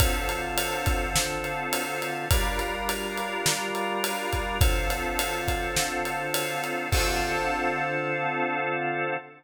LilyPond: <<
  \new Staff \with { instrumentName = "Drawbar Organ" } { \time 4/4 \key d \minor \tempo 4 = 104 <d c' f' a'>1 | <g d' f' bes'>1 | <d c' f' a'>1 | <d c' f' a'>1 | }
  \new DrumStaff \with { instrumentName = "Drums" } \drummode { \time 4/4 <bd cymr>8 cymr8 cymr8 <bd cymr>8 sn8 cymr8 cymr8 cymr8 | <bd cymr>8 cymr8 cymr8 cymr8 sn8 cymr8 cymr8 <bd cymr>8 | <bd cymr>8 cymr8 cymr8 <bd cymr>8 sn8 cymr8 cymr8 cymr8 | <cymc bd>4 r4 r4 r4 | }
>>